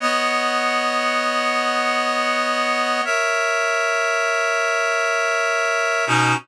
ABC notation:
X:1
M:4/4
L:1/8
Q:1/4=79
K:B
V:1 name="Clarinet"
[B,cdf]8 | [Ace]8 | [B,,CDF]2 z6 |]